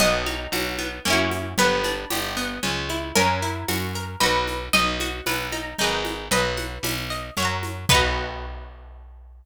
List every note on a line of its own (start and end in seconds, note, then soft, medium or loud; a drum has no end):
0.00 0.47 B1 loud
0.00 0.24 B3 medium
0.00 1.48 D#5 medium
0.00 crash medium
0.00 cowbell medium
0.00 low conga medium
0.00 shaker medium
0.26 0.50 D#4 medium
0.26 high conga medium
0.26 shaker medium
0.52 0.99 B1 medium
0.52 0.76 F#4 medium
0.52 tambourine medium
0.52 cowbell medium
0.52 high conga medium
0.52 shaker medium
0.78 1.02 B3 medium
0.78 high conga medium
0.78 shaker medium
1.05 1.54 F#2 loud
1.05 1.53 A#3 medium
1.05 1.53 C#4 loud
1.05 cowbell medium
1.05 low conga medium
1.05 shaker medium
1.10 1.53 E4 loud
1.10 1.53 F#4 loud
1.31 high conga medium
1.31 shaker medium
1.58 2.05 G1 loud
1.58 1.82 B3 loud
1.58 3.06 B4 medium
1.58 cowbell medium
1.58 low conga medium
1.58 shaker medium
1.84 2.08 D4 medium
1.84 high conga medium
1.84 shaker medium
2.10 2.59 G1 loud
2.10 2.34 G4 medium
2.10 tambourine medium
2.10 cowbell medium
2.10 high conga medium
2.10 shaker medium
2.37 2.60 B3 medium
2.37 shaker medium
2.63 3.12 C#2 loud
2.63 2.87 C#4 medium
2.63 cowbell medium
2.63 low conga medium
2.63 shaker medium
2.89 3.13 E4 medium
2.89 high conga medium
2.89 shaker medium
3.15 3.64 F#2 loud
3.15 3.40 C#4 loud
3.15 4.00 A#4 medium
3.15 cowbell medium
3.15 low conga medium
3.15 shaker medium
3.42 3.66 E4 medium
3.42 shaker medium
3.68 4.16 F#2 medium
3.68 3.92 F#4 medium
3.68 tambourine medium
3.68 cowbell medium
3.68 high conga medium
3.68 shaker medium
3.95 4.19 A#4 medium
3.95 shaker medium
4.20 4.69 B1 loud
4.20 4.68 D#4 medium
4.20 4.68 F#4 loud
4.20 4.63 B4 medium
4.20 cowbell medium
4.20 low conga medium
4.20 shaker medium
4.26 4.68 B4 medium
4.48 high conga medium
4.48 shaker medium
4.73 5.21 B1 loud
4.73 4.97 D#4 medium
4.73 6.07 D#5 medium
4.73 cowbell medium
4.73 low conga medium
4.73 shaker medium
5.00 5.24 F#4 medium
5.00 high conga medium
5.00 shaker medium
5.26 5.74 B1 medium
5.26 5.50 B4 medium
5.26 tambourine medium
5.26 cowbell medium
5.26 high conga medium
5.26 shaker medium
5.52 5.76 D#4 medium
5.52 high conga medium
5.52 shaker medium
5.79 6.29 G#1 loud
5.79 6.26 D#4 loud
5.79 6.26 G#4 loud
5.79 cowbell medium
5.79 low conga medium
5.79 shaker medium
5.84 6.26 B4 medium
6.05 high conga medium
6.05 shaker medium
6.31 6.78 B1 loud
6.31 7.28 B4 medium
6.31 6.56 D#5 medium
6.31 cowbell medium
6.31 low conga medium
6.31 shaker medium
6.57 6.81 F#5 medium
6.57 high conga medium
6.57 shaker medium
6.83 7.30 B1 loud
6.83 7.08 B5 medium
6.83 tambourine medium
6.83 cowbell medium
6.83 high conga medium
6.83 shaker medium
7.10 7.34 D#5 medium
7.10 shaker medium
7.37 7.86 F#2 loud
7.37 7.85 C#5 loud
7.37 7.85 E5 medium
7.37 cowbell medium
7.37 low conga medium
7.37 shaker medium
7.42 7.85 F#5 loud
7.42 7.85 A#5 medium
7.63 high conga medium
7.63 shaker medium
7.89 9.45 B1 loud
7.89 9.45 B3 loud
7.89 9.45 D#4 loud
7.89 9.45 B4 loud
7.89 kick loud
7.89 crash loud
7.94 9.45 F#4 loud